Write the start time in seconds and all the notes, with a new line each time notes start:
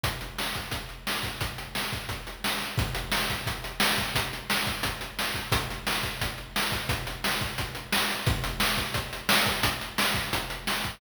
0.03 kick, closed hi-hat
0.21 closed hi-hat
0.38 snare
0.55 kick, closed hi-hat
0.71 kick, closed hi-hat
0.89 closed hi-hat
1.07 snare
1.23 kick, closed hi-hat
1.41 kick, closed hi-hat
1.58 closed hi-hat
1.75 snare
1.93 kick, closed hi-hat
2.09 kick, closed hi-hat
2.27 closed hi-hat
2.44 snare
2.61 closed hi-hat
2.78 kick, closed hi-hat
2.95 closed hi-hat
3.12 snare
3.30 kick, closed hi-hat
3.46 kick, closed hi-hat
3.64 closed hi-hat
3.80 snare
3.98 kick, closed hi-hat
4.15 kick, closed hi-hat
4.33 closed hi-hat
4.50 snare
4.67 kick, closed hi-hat
4.83 kick, closed hi-hat
5.01 closed hi-hat
5.19 snare
5.34 kick, closed hi-hat
5.52 kick, closed hi-hat
5.70 closed hi-hat
5.87 snare
6.03 kick, closed hi-hat
6.21 kick, closed hi-hat
6.38 closed hi-hat
6.56 snare
6.72 kick, closed hi-hat
6.89 kick, closed hi-hat
7.07 closed hi-hat
7.24 snare
7.41 kick, closed hi-hat
7.58 kick, closed hi-hat
7.75 closed hi-hat
7.92 snare
8.10 closed hi-hat
8.26 kick, closed hi-hat
8.44 closed hi-hat
8.60 snare
8.77 kick, closed hi-hat
8.94 kick, closed hi-hat
9.13 closed hi-hat
9.29 snare
9.46 kick, closed hi-hat
9.63 kick, closed hi-hat
9.81 closed hi-hat
9.98 snare
10.14 kick, closed hi-hat
10.33 kick, closed hi-hat
10.50 closed hi-hat
10.67 snare
10.84 kick, closed hi-hat